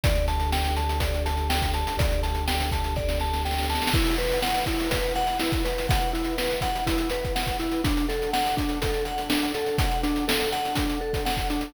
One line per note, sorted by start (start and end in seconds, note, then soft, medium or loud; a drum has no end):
0.03 1.83 D2 loud
0.03 3.90 D4 medium
0.03 3.90 G4 medium
0.03 3.90 A4 medium
0.03 0.26 D5 medium
0.03 kick loud
0.03 closed hi-hat loud
0.15 closed hi-hat medium
0.28 0.50 A5 medium
0.28 closed hi-hat medium
0.40 closed hi-hat medium
0.52 0.74 G5 medium
0.52 snare loud
0.64 snare medium
0.64 closed hi-hat medium
0.77 0.99 A5 medium
0.77 closed hi-hat medium
0.89 closed hi-hat medium
1.00 1.23 D5 medium
1.00 kick medium
1.00 closed hi-hat medium
1.14 closed hi-hat medium
1.26 1.48 A5 medium
1.26 closed hi-hat medium
1.37 closed hi-hat medium
1.50 1.72 G5 medium
1.50 snare loud
1.62 kick medium
1.62 closed hi-hat medium
1.73 1.96 A5 medium
1.73 closed hi-hat medium
1.87 closed hi-hat medium
1.97 3.77 D2 medium
1.97 2.21 D5 medium
1.97 kick loud
1.97 closed hi-hat loud
2.11 closed hi-hat medium
2.23 2.45 A5 medium
2.23 closed hi-hat medium
2.35 closed hi-hat medium
2.48 2.70 G5 medium
2.48 snare loud
2.60 snare medium
2.60 closed hi-hat medium
2.71 2.94 A5 medium
2.71 kick medium
2.71 closed hi-hat medium
2.84 closed hi-hat medium
2.96 3.18 D5 medium
2.96 kick medium
2.96 snare medium
3.09 snare medium
3.20 3.43 A5 medium
3.20 snare medium
3.33 snare medium
3.45 3.67 G5 medium
3.45 snare medium
3.51 snare medium
3.58 snare medium
3.63 snare medium
3.69 3.92 A5 medium
3.69 snare medium
3.75 snare medium
3.82 snare medium
3.87 snare loud
3.94 4.16 E4 loud
3.94 7.80 E4 medium
3.94 7.80 B4 medium
3.94 7.80 F#5 medium
3.94 kick loud
3.94 crash loud
4.07 closed hi-hat medium
4.18 4.40 B4 medium
4.18 closed hi-hat medium
4.31 closed hi-hat medium
4.42 4.65 F#5 medium
4.42 snare loud
4.54 snare medium
4.54 closed hi-hat medium
4.66 4.89 E4 medium
4.66 kick medium
4.66 closed hi-hat medium
4.80 closed hi-hat medium
4.91 5.13 B4 medium
4.91 kick medium
4.91 closed hi-hat loud
5.03 closed hi-hat medium
5.15 5.38 F#5 medium
5.15 closed hi-hat medium
5.27 closed hi-hat medium
5.40 5.63 E4 medium
5.40 snare loud
5.52 kick medium
5.52 closed hi-hat medium
5.65 5.87 B4 medium
5.65 closed hi-hat medium
5.78 closed hi-hat medium
5.89 6.11 F#5 medium
5.89 kick loud
5.89 closed hi-hat loud
6.01 closed hi-hat medium
6.13 6.35 E4 medium
6.13 closed hi-hat medium
6.24 closed hi-hat medium
6.38 6.60 B4 medium
6.38 snare loud
6.50 snare medium
6.50 closed hi-hat medium
6.61 6.84 F#5 medium
6.61 kick medium
6.61 closed hi-hat medium
6.75 closed hi-hat medium
6.87 7.09 E4 medium
6.87 kick medium
6.87 closed hi-hat loud
6.98 closed hi-hat medium
7.10 7.33 B4 medium
7.10 closed hi-hat medium
7.25 kick medium
7.25 closed hi-hat medium
7.35 7.57 F#5 medium
7.35 snare loud
7.47 kick medium
7.47 closed hi-hat medium
7.59 7.81 E4 medium
7.59 snare soft
7.59 closed hi-hat medium
7.71 closed hi-hat medium
7.84 11.70 D4 medium
7.84 8.06 D4 medium
7.84 11.70 A4 medium
7.84 11.70 F#5 medium
7.84 kick loud
7.84 closed hi-hat loud
7.97 closed hi-hat medium
8.09 8.31 A4 medium
8.09 closed hi-hat medium
8.22 closed hi-hat medium
8.33 8.55 F#5 medium
8.33 snare loud
8.44 snare medium
8.44 closed hi-hat medium
8.57 8.79 D4 medium
8.57 kick medium
8.57 closed hi-hat medium
8.69 closed hi-hat medium
8.82 9.04 A4 medium
8.82 kick medium
8.82 closed hi-hat loud
8.94 closed hi-hat medium
9.05 9.28 F#5 medium
9.05 closed hi-hat medium
9.18 closed hi-hat medium
9.30 9.52 D4 medium
9.30 snare loud
9.43 closed hi-hat medium
9.54 9.77 A4 medium
9.54 closed hi-hat medium
9.66 closed hi-hat medium
9.78 10.01 F#5 medium
9.78 kick loud
9.78 closed hi-hat loud
9.91 closed hi-hat medium
10.03 10.25 D4 medium
10.03 closed hi-hat medium
10.16 closed hi-hat medium
10.28 10.50 A4 medium
10.28 snare loud
10.40 snare soft
10.40 closed hi-hat medium
10.52 10.74 F#5 medium
10.52 closed hi-hat medium
10.65 closed hi-hat medium
10.75 10.99 D4 medium
10.75 kick medium
10.75 closed hi-hat loud
10.90 closed hi-hat medium
11.01 11.23 A4 medium
11.01 snare soft
11.13 kick medium
11.13 closed hi-hat medium
11.26 11.47 F#5 medium
11.26 snare loud
11.37 kick medium
11.37 closed hi-hat medium
11.50 11.72 D4 medium
11.50 closed hi-hat medium
11.61 closed hi-hat medium